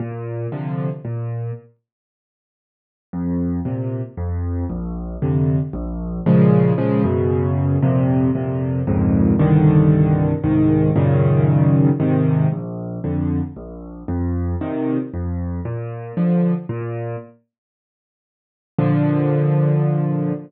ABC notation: X:1
M:3/4
L:1/8
Q:1/4=115
K:Bb
V:1 name="Acoustic Grand Piano" clef=bass
B,,2 [C,D,F,]2 B,,2 | z6 | F,,2 [B,,C,]2 F,,2 | B,,,2 [F,,C,D,]2 B,,,2 |
[K:Bbm] [B,,D,F,A,]2 [B,,D,F,A,] [G,,_C,D,]3 | [F,,B,,C,]2 [F,,B,,C,]2 [D,,F,,A,,B,,]2 | [C,,=G,,=D,E,]4 [C,,A,,E,]2 | [G,,B,,D,E,]4 [A,,C,E,]2 |
[K:Bb] B,,,2 [F,,D,]2 B,,,2 | F,,2 [B,,C,E,]2 F,,2 | B,,2 [D,F,]2 B,,2 | z6 |
[B,,D,F,]6 |]